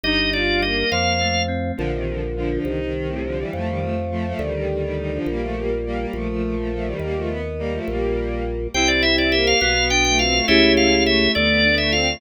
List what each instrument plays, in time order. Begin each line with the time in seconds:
0.04 drawbar organ G1 D#5, electric piano 2 G3, violin D#4
0.32 electric piano 2 D#4, violin F4, drawbar organ D5
0.61 electric piano 2 G3, violin A#3, drawbar organ D#5
0.92 drawbar organ F2 F5, electric piano 2 F3
1.21 electric piano 2 A3
1.48 electric piano 2 C4
1.77 drawbar organ A#1, violin D3 F3
1.93 violin C3 D#3
2.07 violin D3 F3
2.36 violin D3 F3
2.51 violin D3 F3
2.65 drawbar organ C2, violin D#3
2.79 violin D#3
2.94 violin D#3
3.08 violin A2 C3
3.23 violin D3 F3
3.37 violin E3 G3
3.53 drawbar organ F2, violin F3 A3
3.66 violin D#3 G3
3.81 violin F3 A3
4.11 violin F3 A3
4.26 violin F3 A3
4.39 drawbar organ D2, violin D#3 G3
4.53 violin D#3 G3
4.70 violin D#3 G3
4.81 violin D#3 G3
4.97 violin D#3 G3
5.12 violin D3 F3
5.26 drawbar organ A#1, violin G3 A#3
5.41 violin F3 A3
5.56 violin G3 A#3
5.86 violin G3 A#3
5.98 violin G3 A#3
6.13 drawbar organ A#1, violin F3 A3
6.29 violin F3 A3
6.42 violin F3 A3
6.55 violin F3 A3
6.71 violin F3 A3
6.85 violin D#3 G3
7.00 drawbar organ D#2, violin G3 A#3
7.15 violin F3 A3
7.28 violin B3
7.59 violin G3 A#3
7.72 violin F3 A3
7.87 drawbar organ A#1, violin G3 A#3
8.74 drawbar organ C2 G5, electric piano 2 C4, violin C4 E4
8.88 drawbar organ D5
9.03 electric piano 2 E4, drawbar organ E5
9.18 drawbar organ D5
9.31 violin A#3, electric piano 2 G4, drawbar organ E5
9.47 drawbar organ F5
9.61 drawbar organ B1 F5, violin B3, electric piano 2 B3
9.77 violin B3
9.90 violin B3, electric piano 2 D4, drawbar organ G5
10.05 violin A3, drawbar organ G5
10.18 violin C4, electric piano 2 F4, drawbar organ F5
10.32 violin A3
10.46 drawbar organ C#2 E5, electric piano 2 A3 C#4 E4 G4, violin C#4 E4
10.77 drawbar organ F5
11.06 violin A3, drawbar organ E5
11.35 drawbar organ D2 D5, electric piano 2 A3, violin B3
11.48 violin B3
11.64 violin B3, electric piano 2 D4
11.78 violin A3, drawbar organ E5
11.91 violin C4, electric piano 2 F4, drawbar organ F5
12.07 violin A3